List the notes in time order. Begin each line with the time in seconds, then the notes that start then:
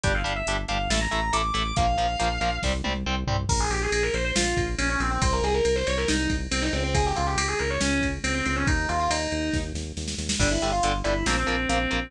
0.04 G1 G3 D4 G5, kick, closed hi-hat
0.15 F5
0.24 G1 G3 D4, closed hi-hat
0.36 E5
0.47 G1 G3 D4, closed hi-hat
0.68 G1 G3 D4 F5, closed hi-hat
0.89 A1 A3 E4 A5, snare
1.01 A#5
1.11 A1 A3 E4, closed hi-hat
1.33 A1 A3 E4 D6, closed hi-hat
1.54 A1 A3 E4, closed hi-hat
1.76 A#1 F3 A#3 F5, kick, closed hi-hat
1.98 A#1 F3 A#3, closed hi-hat
2.19 A#1 F3 A#3, closed hi-hat
2.41 A#1 F3 A#3, closed hi-hat
2.63 C2 G3 C4, kick, snare
2.84 C2 G3 C4, high tom
3.06 C2 G3 C4
3.27 C2 G3 C4, floor tom
3.49 A#1 A#4, kick, crash
3.60 G#4
3.70 A#1 G4, ride
3.82 G#4
3.91 A#1 G#4, ride
4.03 A#4
4.14 A#1 C5, ride
4.25 C5
4.36 A#1 F4, snare
4.57 A#1, kick, ride
4.78 A#1 C#4, ride
4.89 C#4
5.00 A#1 C4, ride
5.11 C4
5.22 C2 C5, kick, ride
5.32 A#4
5.42 C2 G#4, ride
5.54 A#4
5.65 C2 A#4, ride
5.76 C5
5.87 C2 C#5, ride
5.97 A#4
6.08 C2 D#4, snare
6.29 C2, kick, ride
6.51 C2 C4, ride
6.62 D#4
6.73 C#2 C4, ride
6.84 C4
6.94 G#4, kick, ride
7.05 G4
7.16 C#2 F4, ride
7.27 G4
7.36 C#2 G4, ride
7.48 G#4
7.59 C#2 A#4, ride
7.70 C#5
7.81 C#2 C#4, snare
8.01 C#2, kick, ride
8.24 C#2 C4, ride
8.35 C4
8.46 C#2 C4, ride
8.56 C#4
8.67 D#2 D#4, kick, ride
8.89 D#2 F4, ride
8.99 F4
9.09 D#2 D#4, ride
9.32 D#2, ride
9.54 D#2, kick, snare
9.74 D#2, snare
9.97 D#2, snare
10.08 snare
10.18 D#2, snare
10.29 snare
10.39 G1 D3 G3 D4, kick, crash
10.51 E4
10.62 G1 D3 G3, closed hi-hat
10.72 F4
10.83 G1 D3 G3, closed hi-hat
11.04 G1 D3 G3 E4, closed hi-hat
11.26 A#1 F3 A#3 C4, snare
11.37 C4
11.47 A#1 F3 A#3, closed hi-hat
11.69 A#1 F3 A#3 C4, closed hi-hat
11.91 A#1 F3 A#3, closed hi-hat